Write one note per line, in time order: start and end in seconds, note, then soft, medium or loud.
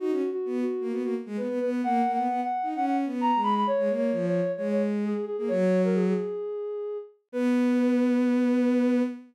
0.00 0.11 D#4 medium
0.00 0.29 F#4 loud
0.11 0.22 C#4 medium
0.32 0.56 F#4 medium
0.45 0.64 B3 medium
0.61 0.88 F#4 medium
0.81 0.92 A#3 medium
0.91 1.02 B3 medium
0.91 1.02 F#4 medium
1.03 1.14 A#3 medium
1.03 1.15 F#4 medium
1.26 1.37 G#3 medium
1.37 1.48 B3 medium
1.37 1.59 B4 medium
1.48 1.59 B3 medium
1.60 1.82 B3 medium
1.60 1.70 B4 medium
1.70 1.81 B4 medium
1.83 2.02 A#3 medium
1.83 2.12 F#5 medium
2.06 2.17 A#3 medium
2.14 2.28 B3 medium
2.14 2.41 F#5 medium
2.29 2.40 B3 medium
2.43 2.69 F#5 medium
2.63 2.74 D#4 medium
2.75 3.05 C#4 medium
2.75 2.85 F#5 medium
2.86 2.97 F#5 medium
3.05 3.31 B3 medium
3.21 3.41 A#5 medium
3.35 3.64 G#3 medium
3.43 3.54 B5 medium
3.56 3.67 B5 medium
3.67 3.93 C#5 loud
3.78 3.89 G#3 medium
3.89 4.11 A#3 medium
3.96 4.26 C#5 medium
4.12 4.41 F3 medium
4.27 4.52 C#5 medium
4.57 5.13 G#3 medium
4.57 4.68 C#5 medium
4.71 4.82 C#5 medium
5.05 5.25 G#4 medium
5.26 5.36 G#4 medium
5.38 5.49 A#3 medium
5.38 5.49 G#4 medium
5.48 6.13 F#3 medium
5.48 5.82 C#5 loud
5.84 5.95 A#4 medium
5.94 6.05 G#4 medium
6.09 6.98 G#4 medium
7.32 9.02 B3 loud
7.32 9.02 B4 loud